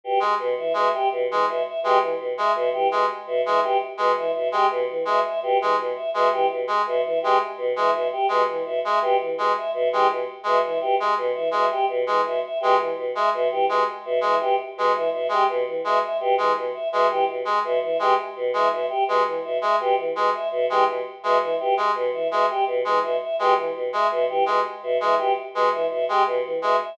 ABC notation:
X:1
M:5/4
L:1/8
Q:1/4=167
K:none
V:1 name="Choir Aahs" clef=bass
B,, z B,, E, B,, z B,, E, B,, z | B,, E, B,, z B,, E, B,, z B,, E, | B,, z B,, E, B,, z B,, E, B,, z | B,, E, B,, z B,, E, B,, z B,, E, |
B,, z B,, E, B,, z B,, E, B,, z | B,, E, B,, z B,, E, B,, z B,, E, | B,, z B,, E, B,, z B,, E, B,, z | B,, E, B,, z B,, E, B,, z B,, E, |
B,, z B,, E, B,, z B,, E, B,, z | B,, E, B,, z B,, E, B,, z B,, E, | B,, z B,, E, B,, z B,, E, B,, z | B,, E, B,, z B,, E, B,, z B,, E, |
B,, z B,, E, B,, z B,, E, B,, z | B,, E, B,, z B,, E, B,, z B,, E, | B,, z B,, E, B,, z B,, E, B,, z |]
V:2 name="Brass Section" clef=bass
z ^G, z2 G, z2 G, z2 | ^G, z2 G, z2 G, z2 G, | z2 ^G, z2 G, z2 G, z | z ^G, z2 G, z2 G, z2 |
^G, z2 G, z2 G, z2 G, | z2 ^G, z2 G, z2 G, z | z ^G, z2 G, z2 G, z2 | ^G, z2 G, z2 G, z2 G, |
z2 ^G, z2 G, z2 G, z | z ^G, z2 G, z2 G, z2 | ^G, z2 G, z2 G, z2 G, | z2 ^G, z2 G, z2 G, z |
z ^G, z2 G, z2 G, z2 | ^G, z2 G, z2 G, z2 G, | z2 ^G, z2 G, z2 G, z |]
V:3 name="Choir Aahs"
G z2 e e G z2 e e | G z2 e e G z2 e e | G z2 e e G z2 e e | G z2 e e G z2 e e |
G z2 e e G z2 e e | G z2 e e G z2 e e | G z2 e e G z2 e e | G z2 e e G z2 e e |
G z2 e e G z2 e e | G z2 e e G z2 e e | G z2 e e G z2 e e | G z2 e e G z2 e e |
G z2 e e G z2 e e | G z2 e e G z2 e e | G z2 e e G z2 e e |]